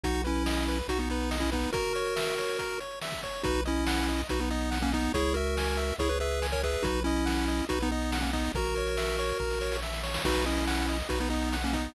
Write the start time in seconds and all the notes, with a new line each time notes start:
0.03 B1 D#4 F#4, kick, closed hi-hat
0.14 closed hi-hat
0.24 C#4 E4 B4, closed hi-hat
0.35 closed hi-hat
0.46 D#5, snare
0.57 closed hi-hat
0.68 B4, closed hi-hat
0.78 closed hi-hat
0.88 B1 D#4 F#4, kick, closed hi-hat
0.99 B3 D#4, closed hi-hat
1.09 B3 D#4 B4, closed hi-hat
1.21 closed hi-hat
1.31 D#5, snare
1.40 C#4 E4, kick, closed hi-hat
1.52 B3 D#4 B4, kick, closed hi-hat
1.63 closed hi-hat
1.73 F#4 A#4, kick, closed hi-hat
1.84 closed hi-hat
1.95 C#5, closed hi-hat
2.06 closed hi-hat
2.16 E5, snare
2.27 closed hi-hat
2.38 C#5, closed hi-hat
2.48 closed hi-hat
2.59 A#4, kick, closed hi-hat
2.70 closed hi-hat
2.80 C#5, closed hi-hat
2.91 closed hi-hat
3.01 E5, snare
3.12 kick, closed hi-hat
3.23 C#5, kick, closed hi-hat
3.34 closed hi-hat
3.43 B1 D#4 F#4 B4, kick, closed hi-hat
3.55 closed hi-hat
3.65 C#4 E4 D#5, closed hi-hat
3.76 closed hi-hat
3.87 F#5, snare
3.97 closed hi-hat
4.08 D#5, closed hi-hat
4.18 closed hi-hat
4.29 B1 D#4 F#4 B4, kick, closed hi-hat
4.40 B3 D#4, closed hi-hat
4.50 B3 D#4 D#5, closed hi-hat
4.61 closed hi-hat
4.71 F#5, snare
4.82 A#3 C#4, kick, closed hi-hat
4.92 B3 D#4 D#5, kick, closed hi-hat
5.04 closed hi-hat
5.14 C#2 E4 G#4 C#5, kick, closed hi-hat
5.25 closed hi-hat
5.34 F#4 A#4 E5, closed hi-hat
5.46 closed hi-hat
5.57 G#5, snare
5.67 closed hi-hat
5.77 E5, closed hi-hat
5.89 closed hi-hat
5.98 C#2 E4 G#4 C#5, kick, closed hi-hat
6.09 G#4 B4, closed hi-hat
6.20 G#4 B4 E5, closed hi-hat
6.31 closed hi-hat
6.42 G#5, snare
6.52 A#4 C#5, kick, closed hi-hat
6.63 G#4 B4 E5, kick, closed hi-hat
6.74 closed hi-hat
6.83 B1 D#4 F#4 B4, kick, closed hi-hat
6.95 closed hi-hat
7.04 C#4 E4 D#5, closed hi-hat
7.16 closed hi-hat
7.26 F#5, snare
7.38 closed hi-hat
7.48 D#5, closed hi-hat
7.59 closed hi-hat
7.69 B1 D#4 F#4 B4, kick, closed hi-hat
7.80 B3 D#4, closed hi-hat
7.91 B3 D#4 D#5
8.01 closed hi-hat
8.12 F#5, snare
8.21 A#3 C#4, kick, closed hi-hat
8.33 B3 D#4 D#5, kick, closed hi-hat
8.44 closed hi-hat
8.54 A#1 F#4 A#4, kick, closed hi-hat
8.65 closed hi-hat
8.76 C#5, closed hi-hat
8.87 closed hi-hat
8.97 E5, snare
9.08 closed hi-hat
9.19 C#5, closed hi-hat
9.29 closed hi-hat
9.40 A#1 A#4, kick
9.50 snare
9.61 C#5, snare
9.72 snare
9.82 E5, snare
9.93 snare
10.03 C#5, snare
10.14 snare
10.24 B1 D#4 F#4 B4, kick, crash
10.36 closed hi-hat
10.46 C#4 E4 D#5, closed hi-hat
10.57 closed hi-hat
10.67 F#5, snare
10.78 closed hi-hat
10.89 D#5, closed hi-hat
11.00 closed hi-hat
11.09 B1 D#4 F#4 B4, kick, closed hi-hat
11.20 B3 D#4, closed hi-hat
11.30 B3 D#4 D#5, closed hi-hat
11.42 closed hi-hat
11.52 F#5, snare
11.63 A#3 C#4, kick, closed hi-hat
11.73 B3 D#4 D#5, kick, closed hi-hat
11.85 closed hi-hat